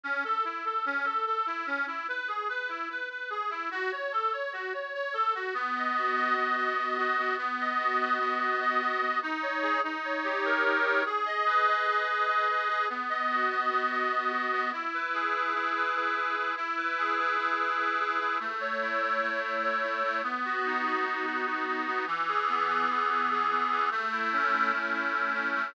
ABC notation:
X:1
M:9/8
L:1/8
Q:3/8=98
K:Bmix
V:1 name="Accordion"
C A E A C A A E C | E B G B E B B G E | F c A c F c c A F | B, d F d B, d d F B, |
B, d F d B, d d F B, | D c G D c =G ^A D c | G d B d G d d B G | B, d F d B, d d F B, |
E B G B E B B G E | E B G B E B B G E | A, c E c A, c c E A, | B, F D F B, F F D B, |
E, G B, G E, G G B, E, | A, E C E A, E E C A, |]